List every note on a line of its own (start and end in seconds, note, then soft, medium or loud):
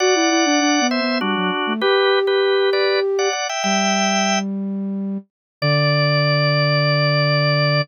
0.00 0.14 F#4 medium
0.00 0.87 D5 medium
0.00 0.87 F#5 medium
0.15 0.30 E4 medium
0.30 0.45 E4 medium
0.45 0.60 D4 medium
0.61 0.80 D4 medium
0.81 1.00 B3 medium
0.91 1.18 C5 medium
0.91 1.18 E5 medium
1.01 1.20 B3 medium
1.21 1.35 G3 medium
1.21 1.73 D4 medium
1.21 1.73 F#4 medium
1.36 1.51 F#3 medium
1.67 1.81 A3 medium
1.81 2.19 G4 medium
1.81 3.29 G4 medium
1.81 2.19 B4 medium
2.27 2.70 G4 medium
2.27 2.70 B4 medium
2.73 3.00 B4 medium
2.73 3.00 D5 medium
3.19 3.32 D5 medium
3.19 3.32 F#5 medium
3.33 3.47 D5 medium
3.33 3.47 F#5 medium
3.49 3.63 E5 medium
3.49 3.63 G5 medium
3.64 5.18 G3 medium
3.64 4.39 E5 medium
3.64 4.39 G5 medium
5.62 7.81 D3 loud
5.62 7.81 D5 loud